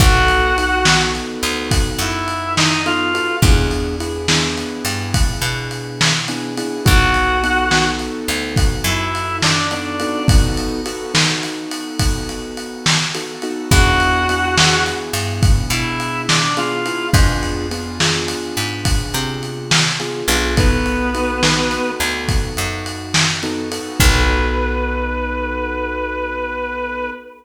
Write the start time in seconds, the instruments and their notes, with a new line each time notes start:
0.00 electric bass (finger) B1, acoustic grand piano B3 D#4 F#4 A4, clarinet F#4 F#5, kick, ride
0.28 ride
0.58 acoustic grand piano B3 D#4 F#4 A4, ride
0.85 acoustic grand piano B3 D#4 F#4 A4, snare
1.15 ride
1.43 electric bass (finger) D2, ride
1.71 kick, ride
1.99 electric bass (finger) F#2, clarinet E4 E5, ride
2.28 ride
2.57 clarinet D#4 D#5, snare
2.86 acoustic grand piano B3 D#4 F#4 A4, clarinet F4 F5, ride
3.14 acoustic grand piano B3 D#4 F#4 A4, ride
3.42 electric bass (finger) E2, acoustic grand piano B3 D4 E4 G#4, kick, ride
3.71 ride
4.00 acoustic grand piano B3 D4 E4 G#4, ride
4.28 acoustic grand piano B3 D4 E4 G#4, snare
4.58 ride
4.85 electric bass (finger) G2, ride
5.14 kick, ride
5.42 electric bass (finger) B2, ride
5.71 ride
6.01 snare
6.28 acoustic grand piano B3 D4 E4 G#4, ride
6.57 acoustic grand piano B3 D4 E4 G#4, ride
6.85 electric bass (finger) B1, acoustic grand piano B3 D#4 F#4 A4, clarinet F#4 F#5, kick, ride
7.14 ride
7.43 acoustic grand piano B3 D#4 F#4 A4, ride
7.71 acoustic grand piano B3 D#4 F#4 A4, snare
7.99 ride
8.28 electric bass (finger) D2, ride
8.56 kick, ride
8.84 electric bass (finger) F#2, clarinet E4 E5, ride
9.15 ride
9.42 clarinet D4 D5, snare
9.71 acoustic grand piano B3 D#4 F#4 A4, clarinet D4 D5, ride
10.00 acoustic grand piano B3 D#4 F#4 A4, ride
10.28 acoustic grand piano B3 D#4 F#4 A4, kick, ride
10.57 ride
10.86 acoustic grand piano B3 D#4 F#4 A4, ride
11.14 acoustic grand piano B3 D#4 F#4 A4, snare
11.43 ride
11.71 ride
11.99 kick, ride
12.29 ride
12.57 ride
12.86 snare
13.15 acoustic grand piano B3 D#4 F#4 A4, ride
13.42 acoustic grand piano B3 D#4 F#4 A4, ride
13.71 electric bass (finger) E2, acoustic grand piano B3 D4 E4 G#4, clarinet F#4 F#5, kick, ride
14.00 ride
14.29 acoustic grand piano B3 D4 E4 G#4, ride
14.57 acoustic grand piano B3 D4 E4 G#4, snare
14.86 ride
15.13 electric bass (finger) G2, ride
15.43 kick, ride
15.70 electric bass (finger) B2, clarinet E4 E5, ride
16.00 ride
16.29 clarinet D4 D5, snare
16.57 acoustic grand piano B3 D4 E4 G#4, clarinet F4 F5, ride
16.86 acoustic grand piano B3 D4 E4 G#4, ride
17.13 electric bass (finger) F2, acoustic grand piano B3 D4 F4 G#4, kick, ride
17.43 ride
17.71 acoustic grand piano B3 D4 F4 G#4, ride
18.00 acoustic grand piano B3 D4 F4 G#4, snare
18.28 ride
18.57 electric bass (finger) G#2, ride
18.85 kick, ride
19.14 electric bass (finger) C3, ride
19.43 ride
19.71 snare
20.00 acoustic grand piano B3 D4 F4 G#4, ride
20.28 electric bass (finger) B1, acoustic grand piano B3 D4 F4 G#4, ride
20.57 clarinet B3 B4, acoustic grand piano B3 D#4 F#4 A4, kick, ride
20.86 ride
21.14 acoustic grand piano B3 D#4 F#4 A4, ride
21.43 acoustic grand piano B3 D#4 F#4 A4, snare
21.71 ride
22.00 electric bass (finger) D2, ride
22.29 kick, ride
22.57 electric bass (finger) F#2, ride
22.86 ride
23.14 snare
23.43 acoustic grand piano B3 D#4 F#4 A4, ride
23.72 acoustic grand piano B3 D#4 F#4 A4, ride
24.00 electric bass (finger) B1, acoustic grand piano B3 D#4 F#4 A4, clarinet B4, kick, crash